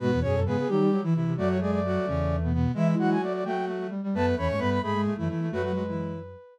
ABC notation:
X:1
M:6/8
L:1/16
Q:3/8=87
K:Emix
V:1 name="Flute"
F z G A G G =G2 z4 | d c d d7 z2 | e z f g d d =g2 z4 | a z b c' b b b2 z4 |
B10 z2 |]
V:2 name="Flute"
[B,B]2 [Cc]2 [B,B]2 [=G,=G]3 [E,E] [E,E]2 | [F,F]2 [G,G]2 [F,F]2 [C,C]3 [B,,B,] [B,,B,]2 | [E,E]2 [F,F]4 [F,F]4 z2 | [B,B]2 [Cc]2 [B,B]2 [G,G]3 [E,E] [E,E]2 |
[F,F] [F,F] [F,F] [E,E]3 z6 |]
V:3 name="Flute"
[G,,G,] [E,,E,] [F,,F,] [F,,F,] [G,,G,] z [_E,_E]2 z4 | [F,,F,]6 [E,,E,]6 | [E,E]4 z8 | [F,,F,]2 [E,,E,] [G,,G,] [=G,,=G,]2 [^G,,^G,] [G,,G,] [A,,A,] [F,,F,] z2 |
[F,,F,]8 z4 |]
V:4 name="Flute"
B,,4 C,2 F, =G, F, E, =C, C, | A,10 z2 | G,4 A,2 A, A, A, A, =G, G, | A,4 A,2 A, A, A, A, A, A, |
A,2 G,4 z6 |]